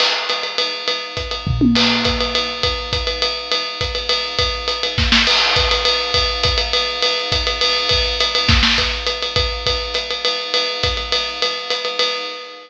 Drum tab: CC |x-----|------|x-----|------|
RD |x-xxx-|x-xx--|x-xxx-|x-xxx-|
HH |--p---|--p---|--p---|--p---|
SD |------|------|------|------|
T1 |------|-----o|------|------|
FT |------|----o-|------|------|
BD |------|--o-o-|--o---|o-o---|

CC |------|------|x-----|------|
RD |x-xxx-|x-xx--|x-xxx-|x-xxx-|
HH |--p---|--p---|--p---|--p---|
SD |------|----oo|------|------|
T1 |------|------|------|------|
FT |------|------|------|------|
BD |--o---|o---o-|--o---|o-o---|

CC |------|------|------|------|
RD |x-xxx-|x-xx--|x-xxx-|x-xxx-|
HH |--p---|--p---|--p---|--p---|
SD |------|----oo|------|------|
T1 |------|------|------|------|
FT |------|------|------|------|
BD |--o---|o---o-|o---o-|o-----|

CC |------|------|
RD |x-xxx-|x-xxx-|
HH |--p---|--p---|
SD |------|------|
T1 |------|------|
FT |------|------|
BD |--o---|------|